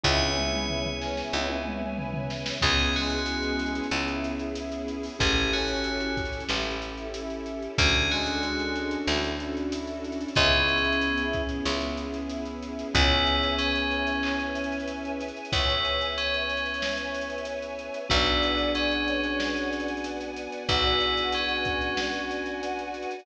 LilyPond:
<<
  \new Staff \with { instrumentName = "Tubular Bells" } { \time 4/4 \key cis \phrygian \tempo 4 = 93 cis''4. r2 r8 | gis'8 fis'4 r2 r8 | gis'8 fis'4 r2 r8 | gis'8 fis'4 r2 r8 |
cis'4. r2 r8 | e'4 cis'2 r4 | e'4 cis'2 r4 | e'4 cis'2 r4 |
e'4 cis'2 r4 | }
  \new Staff \with { instrumentName = "Brass Section" } { \time 4/4 \key cis \phrygian e'4. cis'8 e'4 e'4 | r8 gis4. e'4 e'4 | r8 cis'4. e'4 e'4 | r8 gis4. e'4 e'4 |
e'2 e'4 e'4 | cis'1 | cis''1 | d''4. cis''4 r4. |
fis'1 | }
  \new Staff \with { instrumentName = "Acoustic Grand Piano" } { \time 4/4 \key cis \phrygian <b cis' e' gis'>1 | <b cis' e' gis'>1 | <cis' e' g' a'>1 | <cis' d' fis' a'>1 |
<b cis' e' gis'>1 | <b cis' e' gis'>1~ | <b cis' e' gis'>1 | <b d' fis' gis'>1~ |
<b d' fis' gis'>1 | }
  \new Staff \with { instrumentName = "Electric Bass (finger)" } { \clef bass \time 4/4 \key cis \phrygian cis,2 cis,2 | cis,2 cis,2 | a,,2 a,,2 | d,2 d,2 |
cis,2 cis,2 | cis,1 | cis,1 | b,,1 |
b,,1 | }
  \new Staff \with { instrumentName = "String Ensemble 1" } { \time 4/4 \key cis \phrygian <b' cis'' e'' gis''>1 | <b cis' e' gis'>1 | <cis' e' g' a'>1 | <cis' d' fis' a'>1 |
<b cis' e' gis'>1 | <b' cis'' e'' gis''>1~ | <b' cis'' e'' gis''>1 | <b' d'' fis'' gis''>1~ |
<b' d'' fis'' gis''>1 | }
  \new DrumStaff \with { instrumentName = "Drums" } \drummode { \time 4/4 <bd tommh>16 tommh16 toml16 toml16 tomfh16 tomfh16 sn16 sn16 tommh16 tommh16 toml16 toml16 tomfh16 tomfh16 sn16 sn16 | <cymc bd>16 hh16 hh32 hh32 <hh sn>32 hh32 hh16 hh16 hh32 hh32 hh32 hh32 hc16 hh16 hh16 hh16 hh16 hh16 hh16 hho16 | <hh bd>16 hh16 hh32 hh32 hh32 hh32 hh16 hh16 <hh bd>32 hh32 hh32 hh32 sn16 hh16 hh16 hh16 hh16 hh16 hh16 hh16 | <hh bd>16 hh16 hh16 hh16 hh16 hh16 hh16 hh16 sn16 hh16 hh16 hh16 hh16 hh16 hh32 hh32 hh32 hh32 |
<hh bd>16 hh16 hh32 hh32 hh32 hh32 hh16 hh16 <hh bd>16 hh16 sn16 hh16 hh16 hh16 hh16 hh16 hh16 hh16 | <hh bd>16 hh16 hh16 hh16 hh16 hh16 hh16 hh16 hc16 hh16 hh32 hh32 hh32 hh32 hh16 hh16 hh32 hh32 hh32 hh32 | <hh bd>16 hh16 hh16 hh16 hh16 hh16 hh32 hh32 hh32 hh32 sn16 hh16 hh32 hh32 hh32 hh32 hh16 hh16 hh16 hh16 | <hh bd>16 hh16 hh16 hh16 hh16 hh16 hh16 hh16 sn16 hh16 hh32 hh32 <hh sn>32 hh32 hh16 hh16 <hh sn>16 hh16 |
<hh bd>16 hh16 hh16 hh16 hh16 hh16 <hh bd>16 hh16 sn16 hh16 hh16 hh16 hh16 hh16 hh32 hh32 hh32 hh32 | }
>>